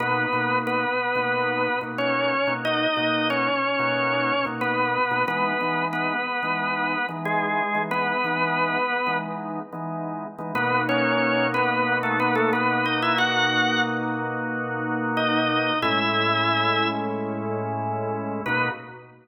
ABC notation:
X:1
M:4/4
L:1/16
Q:1/4=91
K:Bmix
V:1 name="Drawbar Organ"
[B,B]4 [B,B]8 [Cc]4 | [Dd]4 [Cc]8 [B,B]4 | [B,B]4 [B,B]8 [G,G]4 | [B,B]8 z8 |
[B,B]2 [Cc]4 [B,B]3 [A,A] [B,B] [A,A] [B,B]2 [Dd] [Ee] | [Ff]4 z8 [Dd]4 | [Ee]8 z8 | B4 z12 |]
V:2 name="Drawbar Organ"
[B,,^A,DF]2 [B,,A,DF]5 [B,,A,DF]4 [B,,A,DF]4 [B,,A,DF]- | [B,,^A,DF]2 [B,,A,DF]5 [B,,A,DF]4 [B,,A,DF]4 [B,,A,DF] | [E,G,B,D]2 [E,G,B,D]5 [E,G,B,D]4 [E,G,B,D]4 [E,G,B,D]- | [E,G,B,D]2 [E,G,B,D]5 [E,G,B,D]4 [E,G,B,D]4 [E,G,B,D] |
[B,,^A,DF]16- | [B,,^A,DF]16 | [A,,G,CE]16 | [B,,^A,DF]4 z12 |]